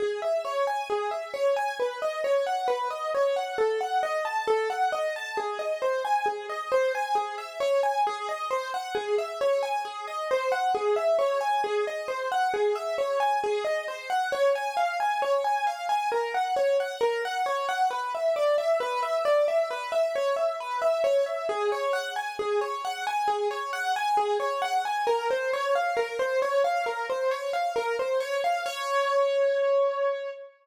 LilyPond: \new Staff { \time 4/4 \key cis \minor \tempo 4 = 134 gis'8 e''8 cis''8 gis''8 gis'8 e''8 cis''8 gis''8 | b'8 dis''8 cis''8 fis''8 b'8 dis''8 cis''8 fis''8 | a'8 fis''8 dis''8 a''8 a'8 fis''8 dis''8 a''8 | gis'8 dis''8 bis'8 gis''8 gis'8 dis''8 bis'8 gis''8 |
gis'8 e''8 cis''8 gis''8 gis'8 dis''8 bis'8 fis''8 | gis'8 e''8 cis''8 gis''8 gis'8 dis''8 bis'8 fis''8 | gis'8 e''8 cis''8 gis''8 gis'8 dis''8 bis'8 fis''8 | gis'8 e''8 cis''8 gis''8 gis'8 dis''8 bis'8 fis''8 |
\key des \major des''8 aes''8 f''8 aes''8 des''8 aes''8 f''8 aes''8 | bes'8 ges''8 des''8 ges''8 bes'8 ges''8 des''8 ges''8 | b'8 e''8 d''8 e''8 b'8 e''8 d''8 e''8 | b'8 e''8 cis''8 e''8 b'8 e''8 cis''8 e''8 |
aes'8 des''8 ges''8 aes''8 aes'8 des''8 ges''8 aes''8 | aes'8 des''8 ges''8 aes''8 aes'8 des''8 ges''8 aes''8 | bes'8 c''8 des''8 f''8 bes'8 c''8 des''8 f''8 | bes'8 c''8 des''8 f''8 bes'8 c''8 des''8 f''8 |
des''1 | }